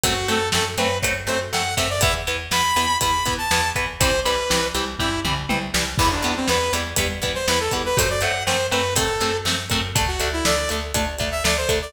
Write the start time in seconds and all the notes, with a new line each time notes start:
0.04 F#2 F#3 A3 C4 F#4, kick, closed hi-hat
0.28 F#2 F#3 A3 C4 A4, closed hi-hat
0.52 F#2 F#3 A3 C4 A4, snare
0.77 F#2 F#3 A3 C4 B4, closed hi-hat
1.02 F#2 F#3 A3 C4, kick, closed hi-hat
1.27 F#2 F#3 A3 C4 C5, closed hi-hat
1.53 F#2 F#3 A3 C4 F#5, snare
1.77 F#2 F#3 A3 C4 E5, kick, closed hi-hat
1.90 D5
2.01 E2 E3 B3 E5, kick, closed hi-hat
2.27 E2 E3 B3, closed hi-hat
2.51 E2 E3 B3 B5, snare
2.76 E2 E3 B3, closed hi-hat
3.01 E2 E3 B3 B5, kick, closed hi-hat
3.26 E2 E3 B3, kick, closed hi-hat
3.38 A5
3.51 E2 E3 B3, snare
3.76 E2 E3 B3, kick, closed hi-hat
4.00 C2 E3 G3 C4 C5, kick, closed hi-hat
4.25 C2 E3 G3 C4 B4, closed hi-hat
4.50 C2 E3 G3 C4, snare
4.75 C2 E3 G3 C4, closed hi-hat
4.99 C2 E3 G3 C4 E4, kick, floor tom
5.25 C2 E3 G3 C4, mid tom
5.49 C2 E3 G3 C4, high tom
5.74 C2 E3 G3 C4, snare
5.98 E2 E3 G3 B3, kick, crash
6.12 D4
6.22 E2 E3 G3 B3, closed hi-hat
6.36 C4
6.48 E2 E3 G3 B3 B4, snare
6.73 E2 E3 G3 B3, closed hi-hat
6.96 E2 E3 G3 B3, kick, closed hi-hat
7.22 E2 E3 G3 B3, kick, closed hi-hat
7.35 C5
7.48 E2 E3 G3 B3 B4, snare
7.60 A4
7.71 E2 E3 G3 B3, kick, closed hi-hat
7.86 B4
7.97 F#2 F#3 A3 C4 C5, kick, closed hi-hat
8.10 D5
8.21 F#2 F#3 A3 C4 F#5, closed hi-hat
8.46 F#2 F#3 A3 C4 C5, snare
8.71 F#2 F#3 A3 C4 B4, closed hi-hat
8.96 F#2 F#3 A3 C4 A4, kick, closed hi-hat
9.20 F#2 F#3 A3 C4, closed hi-hat
9.45 F#2 F#3 A3 C4, snare
9.70 F#2 F#3 A3 C4, kick, closed hi-hat
9.95 D2 A3 D4, kick, closed hi-hat
10.08 F#4
10.20 D2 A3 D4, closed hi-hat
10.33 E4
10.45 D2 A3 D4 D5, snare
10.69 D2 A3 D4, closed hi-hat
10.94 D2 A3 D4, kick, closed hi-hat
11.18 D2 A3 D4, kick, closed hi-hat
11.32 E5
11.44 D2 A3 D4 D5, snare
11.57 C5
11.69 D2 A3 D4, kick, closed hi-hat
11.82 D5